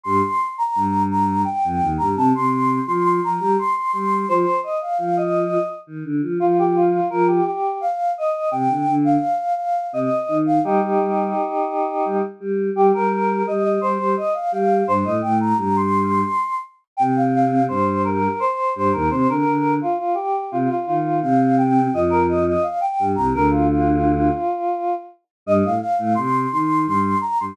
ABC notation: X:1
M:3/4
L:1/16
Q:1/4=85
K:Cdor
V:1 name="Choir Aahs"
c'3 b3 b2 g3 b | a c'3 c' c' b2 c' c' c'2 | c2 e f f e3 z4 | F G F2 B G G2 f2 e2 |
g3 f3 f2 e3 f | [EG]10 z2 | G B3 e e c2 e f f2 | c e g b b c'5 z2 |
g f f2 c2 B2 c2 c B | c B3 F F G2 F F F2 | f2 g2 e B e e f g2 b | B F F8 z2 |
e f f2 c'2 c'2 c'2 b c' |]
V:2 name="Choir Aahs"
[G,,G,] z3 [G,,G,]4 z [F,,F,] [E,,E,] [G,,G,] | [C,C] [C,C]3 [F,F]2 [F,F] [G,G] z2 [G,G]2 | [F,F] z3 [F,F]4 z [E,E] [D,D] [F,F] | [F,F]4 [F,F]2 z6 |
[C,C] [D,D] [D,D]2 z4 [C,C] z [E,E]2 | [G,G] [G,G] [G,G]2 z4 [G,G] z [G,G]2 | [G,G] [G,G]3 [G,G]2 [G,G] [G,G] z2 [G,G]2 | [G,,G,] [A,,A,] [A,,A,]2 [G,,G,]4 z4 |
[C,C]4 [G,,G,]4 z2 [G,,G,] [E,,E,] | [C,C] [D,D] [D,D]2 z4 [C,C] z [E,E]2 | [C,C]4 [F,,F,]4 z2 [G,,G,] [C,,C,] | [D,,D,]6 z6 |
[G,,G,] [A,,A,] z [A,,A,] [C,C]2 [E,E]2 [G,,G,]2 z [G,,G,] |]